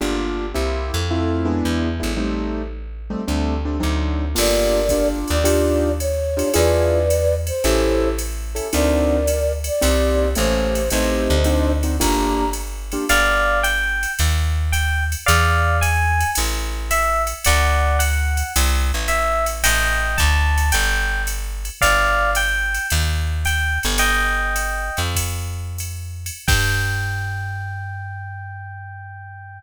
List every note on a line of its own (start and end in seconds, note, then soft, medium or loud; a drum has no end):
0.01 0.53 G1 medium
0.01 0.45 A#3 medium
0.01 0.45 D4 medium
0.01 0.45 F4 medium
0.01 0.45 G4 medium
0.54 0.91 C2 medium
0.54 0.99 A#3 medium
0.54 0.99 C4 medium
0.54 0.99 E4 medium
0.54 0.99 G4 medium
0.94 1.62 F2 medium
1.10 1.46 A3 medium
1.10 1.46 C4 medium
1.10 1.45 E4 medium
1.10 1.46 F4 medium
1.45 1.88 G#3 medium
1.45 1.88 B3 medium
1.45 1.88 D4 medium
1.45 1.88 E4 medium
1.65 2.01 E2 medium
2.00 3.15 A1 medium
2.00 2.12 G#3 medium
2.00 2.12 B3 medium
2.00 2.12 D4 medium
2.00 2.12 E4 medium
2.17 2.62 G3 medium
2.17 2.62 A3 medium
2.17 2.62 C4 medium
2.17 2.62 D#4 medium
3.10 3.22 G3 medium
3.10 3.22 A3 medium
3.10 3.22 C4 medium
3.10 3.22 D#4 medium
3.28 3.80 D2 medium
3.28 3.54 G3 medium
3.28 3.54 A3 medium
3.28 3.54 C4 medium
3.28 3.54 D4 medium
3.65 3.77 G3 medium
3.65 3.77 A3 medium
3.65 3.77 C4 medium
3.65 3.77 D4 medium
3.80 4.35 D2 medium
3.80 4.25 F#3 medium
3.80 4.25 C4 medium
3.80 4.25 D4 medium
3.80 4.25 D#4 medium
4.35 5.25 G1 medium
4.35 4.80 A#3 medium
4.35 4.80 D4 medium
4.35 4.80 F4 medium
4.35 4.80 G4 medium
4.35 5.08 A#4 medium
4.35 5.08 D5 medium
4.35 crash loud
4.35 ride medium
4.89 5.35 A#3 medium
4.89 5.35 D4 medium
4.89 5.35 F4 medium
4.89 5.35 G4 medium
4.89 kick medium
4.89 hi-hat pedal loud
4.89 ride medium
5.28 6.43 D#2 medium
5.28 5.92 D5 medium
5.28 ride medium
5.44 5.89 D4 medium
5.44 5.89 D#4 medium
5.44 5.89 F4 medium
5.44 5.89 G4 medium
5.44 ride loud
6.00 6.54 C#5 medium
6.00 hi-hat pedal medium
6.00 ride medium
6.37 6.48 D4 medium
6.37 6.48 D#4 medium
6.37 6.48 F4 medium
6.37 6.48 G4 medium
6.37 ride medium
6.54 7.51 E2 medium
6.54 6.99 D4 medium
6.54 6.99 E4 medium
6.54 6.99 F4 medium
6.54 6.99 G#4 medium
6.54 7.35 B4 medium
6.54 7.35 D5 medium
6.54 ride loud
7.10 hi-hat pedal loud
7.10 ride medium
7.47 8.09 C5 medium
7.47 ride medium
7.64 8.60 A1 loud
7.64 8.09 C#4 medium
7.64 8.09 E4 medium
7.64 8.09 G4 medium
7.64 8.09 A4 medium
7.64 ride medium
8.19 hi-hat pedal medium
8.19 ride medium
8.55 8.67 C#4 medium
8.55 8.67 E4 medium
8.55 8.67 G4 medium
8.55 8.67 A4 medium
8.55 ride medium
8.73 9.70 D2 medium
8.73 9.18 C4 medium
8.73 9.18 D4 medium
8.73 9.18 D#4 medium
8.73 9.18 F#4 medium
8.73 9.52 A#4 medium
8.73 9.52 D5 medium
8.73 ride loud
9.27 hi-hat pedal medium
9.27 ride medium
9.64 10.29 D5 medium
9.64 ride medium
9.81 10.35 C2 loud
9.81 10.26 A#3 medium
9.81 10.26 C4 medium
9.81 10.26 D#4 medium
9.81 10.26 G4 medium
9.81 ride loud
10.35 10.89 A1 loud
10.35 10.81 A3 medium
10.35 10.81 A#3 medium
10.35 10.81 C#4 medium
10.35 10.81 G4 medium
10.35 10.90 C5 medium
10.35 hi-hat pedal medium
10.35 ride medium
10.75 ride medium
10.90 11.28 A1 medium
10.90 11.36 A3 medium
10.90 11.36 C4 medium
10.90 11.36 D#4 medium
10.90 11.36 G4 medium
10.90 11.72 C5 medium
10.90 11.72 D#5 medium
10.90 ride loud
11.30 11.99 D2 loud
11.44 11.72 C4 medium
11.44 11.72 D4 medium
11.44 11.72 D#4 medium
11.44 11.72 F#4 medium
11.44 hi-hat pedal medium
11.44 ride medium
11.83 11.95 C4 medium
11.83 11.95 D4 medium
11.83 11.95 D#4 medium
11.83 11.95 F#4 medium
11.83 ride medium
12.00 12.97 G1 medium
12.00 12.45 A#3 medium
12.00 12.45 D4 medium
12.00 12.45 F4 medium
12.00 12.45 G4 medium
12.00 12.50 A#5 medium
12.00 kick medium
12.00 ride loud
12.53 hi-hat pedal medium
12.53 ride medium
12.92 13.04 A#3 medium
12.92 13.04 D4 medium
12.92 13.04 F4 medium
12.92 13.04 G4 medium
12.92 ride medium
13.09 14.06 G1 loud
13.09 13.59 D5 loud
13.09 13.59 F5 loud
13.09 ride loud
13.63 14.12 G5 loud
13.63 hi-hat pedal medium
13.63 ride medium
14.03 ride medium
14.19 15.15 D#2 loud
14.19 ride loud
14.72 15.04 G5 loud
14.72 hi-hat pedal medium
14.72 ride medium
15.12 ride medium
15.26 16.24 E2 loud
15.26 15.77 D5 loud
15.26 15.77 F5 loud
15.26 ride loud
15.81 16.30 G#5 loud
15.81 hi-hat pedal medium
15.81 ride loud
16.20 ride medium
16.35 17.33 A1 loud
16.35 ride loud
16.91 17.22 E5 loud
16.91 hi-hat pedal medium
16.91 ride loud
17.27 ride medium
17.45 18.43 D2 loud
17.45 17.97 D5 loud
17.45 17.97 F#5 loud
17.45 ride loud
17.99 18.52 F#5 loud
17.99 hi-hat pedal medium
17.99 ride loud
18.37 ride medium
18.56 18.92 C2 loud
18.56 ride loud
18.94 19.63 A1 medium
19.08 19.45 E5 loud
19.08 hi-hat pedal medium
19.08 ride medium
19.46 ride medium
19.64 20.17 A1 loud
19.64 20.17 D#5 loud
19.64 20.17 G5 loud
19.64 ride loud
20.18 20.71 D2 loud
20.18 20.69 A5 loud
20.18 kick medium
20.18 hi-hat pedal medium
20.18 ride medium
20.58 ride medium
20.72 21.70 G1 loud
20.72 21.22 G5 loud
20.72 ride loud
21.27 hi-hat pedal medium
21.27 ride medium
21.65 ride medium
21.81 22.79 G1 loud
21.81 22.30 D5 loud
21.81 22.30 F5 loud
21.81 kick medium
21.81 ride loud
22.35 22.87 G5 loud
22.35 hi-hat pedal medium
22.35 ride loud
22.74 ride medium
22.90 23.79 D#2 loud
22.90 ride loud
23.45 23.79 G5 loud
23.45 hi-hat pedal medium
23.45 ride medium
23.83 24.90 G1 loud
23.83 ride medium
23.98 25.01 D#5 loud
23.98 25.01 G5 loud
23.98 ride loud
24.56 hi-hat pedal medium
24.56 ride medium
24.97 26.31 F2 medium
24.97 ride medium
25.15 kick medium
25.15 ride loud
25.78 hi-hat pedal medium
25.78 ride medium
26.26 ride medium
26.48 29.60 G2 loud
26.48 29.59 G5 loud
26.48 kick loud
26.48 crash loud